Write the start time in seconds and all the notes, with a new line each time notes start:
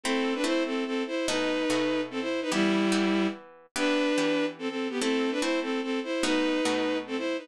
0.03 A3 C4 E4 A4
0.35 D4 B4
0.44 A3 C4 E4 C5
0.66 C4 A4
0.86 C4 A4
1.07 E4 C5
1.28 B2 A3 D#4 F#4 B4
1.70 B2 A3 D#4 F#4
2.11 C4 A4
2.21 E4 C5
2.42 D#4 B4
2.52 E3 G3 B3 E4 G4
2.92 E3 B3 G4
3.76 E3 B3 D4 G4 B4
4.18 E3 B3 G4
4.59 C4 A4
4.69 C4 A4
4.90 B3 G4
5.00 A3 C4 E4 A4
5.31 D4 B4
5.41 A3 C4 E4 C5
5.62 C4 A4
5.83 C4 A4
6.04 E4 C5
6.23 B2 A3 D#4 F#4 B4
6.65 B2 A3 D#4 F#4
7.07 C4 A4
7.17 E4 C5
7.38 D#4 B4